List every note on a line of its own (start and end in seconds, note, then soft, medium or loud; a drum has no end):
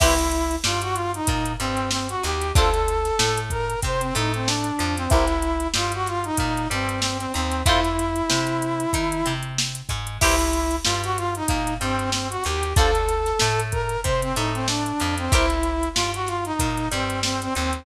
0.00 0.57 C2 medium
0.00 0.14 E4 loud
0.00 0.55 E4 loud
0.00 0.14 G4 loud
0.00 0.14 B4 loud
0.00 0.14 C5 loud
0.00 kick medium
0.00 crash medium
0.18 closed hi-hat medium
0.32 closed hi-hat medium
0.51 closed hi-hat medium
0.64 1.20 G2 medium
0.64 1.19 G3 medium
0.64 0.81 F4 medium
0.64 snare medium
0.82 0.95 F#4 loud
0.82 closed hi-hat medium
0.94 1.11 F4 loud
0.94 closed hi-hat medium
1.14 1.52 D#4 loud
1.14 closed hi-hat medium
1.27 1.56 A#2 medium
1.27 1.55 A#3 medium
1.27 kick medium
1.27 closed hi-hat medium
1.45 closed hi-hat medium
1.60 2.16 G2 medium
1.60 2.15 G3 medium
1.60 1.89 C4 loud
1.60 closed hi-hat medium
1.77 closed hi-hat medium
1.91 2.08 C4 medium
1.91 snare medium
2.09 2.23 F#4 loud
2.09 closed hi-hat medium
2.23 2.52 D#2 medium
2.23 2.51 D#4 medium
2.23 2.52 G4 medium
2.23 closed hi-hat medium
2.41 closed hi-hat medium
2.55 3.11 D2 medium
2.55 2.70 D4 loud
2.55 2.70 F4 loud
2.55 3.39 A4 loud
2.55 2.70 A4 loud
2.55 2.70 C5 loud
2.55 kick loud
2.55 closed hi-hat medium
2.74 closed hi-hat medium
2.88 closed hi-hat medium
3.05 snare soft
3.05 closed hi-hat medium
3.19 3.75 A2 medium
3.19 3.75 A3 medium
3.19 snare medium
3.38 closed hi-hat medium
3.50 3.80 A#4 loud
3.50 kick medium
3.50 closed hi-hat medium
3.70 closed hi-hat medium
3.82 4.12 C3 medium
3.82 4.11 C4 medium
3.82 4.02 C5 loud
3.82 kick medium
3.82 closed hi-hat medium
4.00 4.14 C4 medium
4.00 closed hi-hat medium
4.15 4.72 A2 loud
4.15 4.70 A3 medium
4.15 4.32 D#4 medium
4.15 closed hi-hat medium
4.34 4.48 C4 medium
4.34 closed hi-hat medium
4.47 4.95 D4 medium
4.47 snare medium
4.64 closed hi-hat medium
4.79 5.08 F2 medium
4.79 5.07 F3 medium
4.79 closed hi-hat medium
4.97 5.11 C4 loud
4.97 closed hi-hat medium
5.10 5.67 C2 medium
5.10 5.25 E4 loud
5.10 5.67 E4 loud
5.10 5.25 G4 loud
5.10 5.25 A#4 loud
5.10 5.25 C5 loud
5.10 kick medium
5.10 closed hi-hat medium
5.28 closed hi-hat medium
5.42 closed hi-hat medium
5.60 closed hi-hat medium
5.74 6.31 G2 medium
5.74 6.30 G3 medium
5.74 5.92 F4 medium
5.74 snare medium
5.92 6.07 F#4 loud
5.92 closed hi-hat medium
6.06 6.24 F4 medium
6.06 snare soft
6.06 closed hi-hat medium
6.24 6.68 D#4 loud
6.24 closed hi-hat medium
6.37 6.67 A#2 medium
6.37 6.66 A#3 medium
6.37 kick medium
6.37 closed hi-hat medium
6.57 closed hi-hat medium
6.70 7.27 G2 medium
6.70 7.26 G3 medium
6.70 7.00 C4 medium
6.70 closed hi-hat medium
6.89 closed hi-hat medium
7.00 7.17 C4 medium
7.00 snare medium
7.19 7.32 C4 loud
7.19 snare soft
7.19 closed hi-hat medium
7.34 7.63 D#2 medium
7.34 7.63 C4 loud
7.34 7.62 D#4 medium
7.34 closed hi-hat medium
7.52 closed hi-hat medium
7.66 8.22 F2 medium
7.66 7.80 E4 loud
7.66 9.33 E4 loud
7.66 7.80 F4 loud
7.66 7.80 A4 loud
7.66 7.80 C5 loud
7.66 kick medium
7.66 closed hi-hat medium
7.84 closed hi-hat medium
7.99 closed hi-hat medium
8.16 closed hi-hat medium
8.30 8.86 C3 medium
8.30 8.85 C4 medium
8.30 snare medium
8.47 closed hi-hat medium
8.62 closed hi-hat medium
8.80 closed hi-hat medium
8.93 9.22 D#3 medium
8.93 9.21 D#4 medium
8.93 kick medium
8.93 closed hi-hat medium
9.12 closed hi-hat medium
9.26 9.82 C3 medium
9.26 9.81 C4 medium
9.26 closed hi-hat medium
9.43 closed hi-hat medium
9.58 snare medium
9.75 closed hi-hat medium
9.89 10.18 G#2 medium
9.89 10.17 G#3 medium
9.89 kick medium
9.89 closed hi-hat medium
10.07 closed hi-hat medium
10.21 10.78 C2 medium
10.21 10.76 E4 loud
10.21 10.36 E4 loud
10.21 10.36 G4 loud
10.21 10.36 B4 loud
10.21 10.36 C5 loud
10.21 kick medium
10.21 crash medium
10.39 closed hi-hat medium
10.53 closed hi-hat medium
10.71 closed hi-hat medium
10.84 11.42 G2 medium
10.84 11.41 G3 medium
10.84 11.01 F4 medium
10.84 snare medium
11.04 11.17 F#4 loud
11.04 closed hi-hat medium
11.17 11.34 F4 loud
11.17 closed hi-hat medium
11.35 11.74 D#4 loud
11.35 closed hi-hat medium
11.48 11.78 A#2 medium
11.48 11.77 A#3 medium
11.48 kick medium
11.48 closed hi-hat medium
11.67 closed hi-hat medium
11.80 12.37 G2 medium
11.80 12.36 G3 medium
11.80 12.10 C4 loud
11.80 closed hi-hat medium
11.99 closed hi-hat medium
12.11 12.28 C4 medium
12.11 snare medium
12.30 12.43 F#4 loud
12.30 closed hi-hat medium
12.44 12.74 D#2 medium
12.44 12.72 D#4 medium
12.44 12.73 G4 medium
12.44 closed hi-hat medium
12.63 closed hi-hat medium
12.76 13.33 D2 medium
12.76 12.91 D4 loud
12.76 12.91 F4 loud
12.76 13.60 A4 loud
12.76 12.91 A4 loud
12.76 12.91 C5 loud
12.76 kick loud
12.76 closed hi-hat medium
12.95 closed hi-hat medium
13.09 closed hi-hat medium
13.26 snare soft
13.26 closed hi-hat medium
13.39 13.97 A2 medium
13.39 13.96 A3 medium
13.39 snare medium
13.60 closed hi-hat medium
13.72 14.01 A#4 loud
13.72 kick medium
13.72 closed hi-hat medium
13.89 closed hi-hat medium
14.03 14.33 C3 medium
14.03 14.32 C4 medium
14.03 14.21 C5 loud
14.03 kick medium
14.03 closed hi-hat medium
14.22 14.35 C4 medium
14.22 closed hi-hat medium
14.36 14.92 A2 loud
14.36 14.92 A3 medium
14.36 14.53 D#4 medium
14.36 closed hi-hat medium
14.54 14.67 C4 medium
14.54 closed hi-hat medium
14.67 15.15 D4 medium
14.67 snare medium
14.86 closed hi-hat medium
15.00 15.29 F2 medium
15.00 15.28 F3 medium
15.00 closed hi-hat medium
15.18 15.32 C4 loud
15.18 closed hi-hat medium
15.32 15.88 C2 medium
15.32 15.46 E4 loud
15.32 15.89 E4 loud
15.32 15.46 G4 loud
15.32 15.46 A#4 loud
15.32 15.46 C5 loud
15.32 kick medium
15.32 closed hi-hat medium
15.50 closed hi-hat medium
15.63 closed hi-hat medium
15.83 closed hi-hat medium
15.94 16.52 G2 medium
15.94 16.51 G3 medium
15.94 16.11 F4 medium
15.94 snare medium
16.14 16.28 F#4 loud
16.14 closed hi-hat medium
16.26 16.44 F4 medium
16.26 snare soft
16.26 closed hi-hat medium
16.45 16.88 D#4 loud
16.45 closed hi-hat medium
16.59 16.88 A#2 medium
16.59 16.87 A#3 medium
16.59 kick medium
16.59 closed hi-hat medium
16.77 closed hi-hat medium
16.91 17.48 G2 medium
16.91 17.47 G3 medium
16.91 17.20 C4 medium
16.91 closed hi-hat medium
17.10 closed hi-hat medium
17.23 17.41 C4 medium
17.23 snare medium
17.42 17.54 C4 loud
17.42 snare soft
17.42 closed hi-hat medium
17.54 17.84 D#2 medium
17.54 17.83 C4 loud
17.54 17.83 D#4 medium
17.54 closed hi-hat medium
17.73 closed hi-hat medium